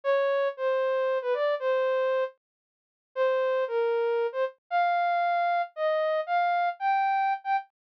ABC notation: X:1
M:6/8
L:1/16
Q:3/8=77
K:Ddor
V:1 name="Ocarina"
^c4 =c5 B d2 | c6 z6 | [K:Fdor] c4 B5 c z2 | f8 e4 |
f4 g5 g z2 |]